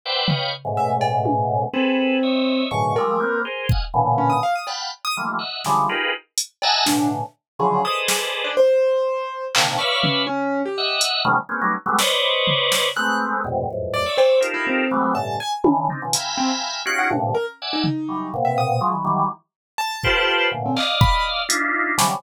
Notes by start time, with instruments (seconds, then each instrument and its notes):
0.05 drawbar organ B4 C5 D5 E5 F#5 G5
0.28 drawbar organ B4 C#5 D#5 F5 G5, floor tom
0.65 drawbar organ G#2 A2 B2 C#3
0.77 acoustic grand piano E5
1.01 cowbell
1.25 high tom
1.73 acoustic grand piano C4, drawbar organ G#4 A4 B4
2.23 drawbar organ C#5 D#5 E5
2.71 drawbar organ F#2 G#2 A2 B2 C#3 D3, acoustic grand piano C#6
2.96 drawbar organ F3 G3 G#3 A3, acoustic grand piano A#4, cowbell
3.20 drawbar organ A#3 B3 C4
3.45 drawbar organ G#4 A#4 C5
3.69 drawbar organ D#5 F5 F#5 G#5, kick
3.94 drawbar organ A#2 B2 C#3 D3 E3
4.18 acoustic grand piano C#4
4.30 acoustic grand piano D#6
4.43 acoustic grand piano F5
4.55 acoustic grand piano D#6
4.67 drawbar organ F5 F#5 G5 A5 B5, cowbell
5.05 acoustic grand piano D#6
5.17 drawbar organ D#3 E3 F3 G3 A3 A#3
5.39 drawbar organ D#5 E5 F#5
5.64 drawbar organ C#3 D3 E3 F3 G3 G#3, snare
5.89 drawbar organ D#4 F4 G4 G#4 A#4 B4
6.38 closed hi-hat
6.62 drawbar organ D#5 E5 F#5 G#5 A5 A#5, cowbell
6.86 drawbar organ A2 B2 C#3 D3, acoustic grand piano D4, snare
7.59 drawbar organ C#3 D3 E3 F3 F#3, acoustic grand piano G#4
7.84 drawbar organ G#4 A4 B4 C5 D5 D#5, acoustic grand piano D#6
8.08 acoustic grand piano G#4, snare
8.44 acoustic grand piano D4
8.57 acoustic grand piano C5
9.55 drawbar organ A#2 C3 D3 D#3, clap
9.78 drawbar organ B4 C#5 D5 E5 F5, acoustic grand piano C#6
10.03 acoustic grand piano C#4, floor tom
10.27 acoustic grand piano C#4
10.65 acoustic grand piano G4
10.78 drawbar organ D#5 E5 F#5
11.01 closed hi-hat
11.25 drawbar organ C3 D3 E3 F#3 G#3 A#3
11.49 drawbar organ G#3 A#3 B3 C4 C#4
11.61 drawbar organ F#3 G3 A3 B3 C#4 D#4
11.86 drawbar organ F#3 G3 G#3 A3 B3
11.99 drawbar organ B4 C5 C#5 D5 D#5, snare
12.47 floor tom
12.72 snare
12.96 drawbar organ G#3 A3 B3 C4, acoustic grand piano F#6
13.44 drawbar organ F2 G2 G#2 A2 B2 C3
13.70 drawbar organ E2 F2 F#2 G#2 A2
13.93 acoustic grand piano D5
14.06 drawbar organ C#5 D5 E5
14.17 acoustic grand piano C5, cowbell
14.40 drawbar organ D#4 F4 G4 A4 A#4, closed hi-hat
14.54 acoustic grand piano E4
14.67 acoustic grand piano C4
14.91 drawbar organ E3 F#3 G3 G#3 A3 B3
15.14 drawbar organ G2 A2 B2 C#3, acoustic grand piano A5
15.40 acoustic grand piano G#5
15.64 drawbar organ C#3 D3 D#3 E3, high tom
15.89 drawbar organ C4 D4 D#4, floor tom
16.02 drawbar organ B2 C#3 D#3 F3
16.13 drawbar organ E5 F5 G5 G#5 A#5 B5, closed hi-hat
16.37 acoustic grand piano C4
16.85 drawbar organ C#4 D#4 F4 F#4 G4, acoustic grand piano F#6
16.99 acoustic grand piano F#5
17.10 drawbar organ G2 A2 A#2 C3 D3, high tom
17.34 acoustic grand piano A#4
17.61 drawbar organ D5 E5 F#5 G#5
17.73 acoustic grand piano D#4
17.84 floor tom
18.08 drawbar organ E3 F#3 G3
18.34 drawbar organ A#2 B2 C3
18.45 acoustic grand piano E5
18.58 acoustic grand piano D#6
18.81 drawbar organ F3 F#3 G#3
18.92 drawbar organ D#3 E3 F#3
19.05 drawbar organ D#3 E3 F#3 G3
19.78 acoustic grand piano A5
20.03 drawbar organ F4 G4 A4 B4 C5, kick
20.52 drawbar organ A2 A#2 B2 C#3 D3
20.66 acoustic grand piano C4
20.76 drawbar organ D5 D#5 F5, clap
21.01 acoustic grand piano B5, kick
21.49 drawbar organ D4 D#4 E4 F4, closed hi-hat
21.98 drawbar organ C3 C#3 D3 E3 F#3 G3, snare